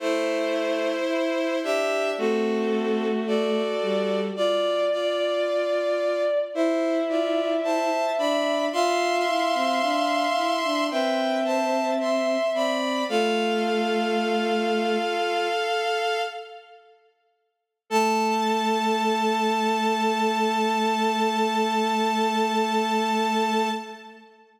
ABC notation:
X:1
M:4/4
L:1/16
Q:1/4=55
K:Am
V:1 name="Violin"
[Ec]6 [Ge]2 [CA]4 [^Fd]4 | [Fd]2 [Fd]6 [Ec]2 [Fd]2 [ca]2 [db]2 | [ec']8 [Bg]2 [ca]2 [ec']2 [db]2 | "^rit." [Af]12 z4 |
a16 |]
V:2 name="Violin"
A,4 E2 D2 ^F4 A4 | d8 e8 | f8 e8 | "^rit." F10 z6 |
A16 |]
V:3 name="Violin"
z8 A,6 G,2 | z8 E6 D2 | F2 E C D2 E D C6 C2 | "^rit." A,8 z8 |
A,16 |]